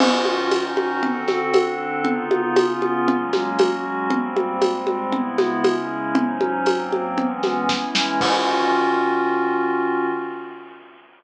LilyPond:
<<
  \new Staff \with { instrumentName = "Pad 5 (bowed)" } { \time 4/4 \key dis \phrygian \tempo 4 = 117 <dis cis' eis' fis'>4 <dis cis' dis' fis'>4 <d c' fis' a'>4 <d c' d' a'>4 | <cis b dis' eis'>4 <cis b cis' eis'>4 <fis gis ais cis'>4 <fis gis cis' fis'>4 | <gis, g ais bis>4 <gis, g gis bis>4 <cis gis b e'>4 <cis gis cis' e'>4 | <gis, fis cis' dis'>4 <gis, fis ais bis>4 <e gis b cis'>4 <e gis cis' e'>4 |
<dis cis' eis' fis'>1 | }
  \new DrumStaff \with { instrumentName = "Drums" } \drummode { \time 4/4 <cgl cymc>8 cgho8 <cgho tamb>8 cgho8 cgl8 <cgho sn>8 <cgho tamb>4 | cgl8 cgho8 <cgho tamb>8 cgho8 cgl8 <cgho sn>8 <cgho tamb>4 | cgl8 cgho8 <cgho tamb>8 cgho8 cgl8 <cgho sn>8 <cgho tamb>4 | cgl8 cgho8 <cgho tamb>8 cgho8 cgl8 <cgho sn>8 <bd sn>8 sn8 |
<cymc bd>4 r4 r4 r4 | }
>>